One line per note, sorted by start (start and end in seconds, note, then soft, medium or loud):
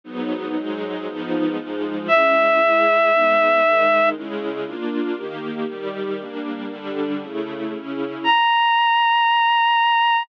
0.04 0.55 G#2 medium
0.04 0.55 F#3 medium
0.04 0.55 B3 medium
0.04 0.55 D#4 medium
0.56 1.06 G#2 medium
0.56 1.06 F#3 medium
0.56 1.06 G#3 medium
0.56 1.06 D#4 medium
1.06 1.57 G#2 medium
1.06 1.57 F3 medium
1.06 1.57 B3 medium
1.06 1.57 D#4 medium
1.57 2.08 G#2 medium
1.57 2.08 F3 medium
1.57 2.08 G#3 medium
1.57 2.08 D#4 medium
2.08 2.59 G#3 medium
2.08 2.59 C#4 medium
2.08 2.59 E4 medium
2.08 4.09 E5 medium
2.60 3.10 G#3 medium
2.60 3.10 E4 medium
2.60 3.10 G#4 medium
3.12 3.62 G#3 medium
3.12 3.63 B3 medium
3.12 3.62 D#4 medium
3.63 4.14 D#3 medium
3.63 4.14 G#3 medium
3.63 4.14 D#4 medium
4.14 4.65 C#3 medium
4.14 4.65 G#3 medium
4.14 4.65 E4 medium
4.65 5.15 A#3 medium
4.65 5.16 D4 medium
4.65 5.16 F4 medium
5.15 5.66 D#3 medium
5.15 5.66 A#3 medium
5.15 5.66 G4 medium
5.68 6.19 D#3 medium
5.68 6.19 G3 medium
5.68 6.19 G4 medium
6.19 6.68 G3 medium
6.19 6.70 A#3 medium
6.19 6.68 D4 medium
6.69 7.20 D3 medium
6.69 7.20 G3 medium
6.69 7.20 D4 medium
7.21 7.72 C#3 medium
7.21 7.72 A3 medium
7.21 7.72 E4 medium
7.74 8.25 C#3 medium
7.74 8.25 C#4 medium
7.74 8.25 E4 medium
8.24 10.23 A#5 medium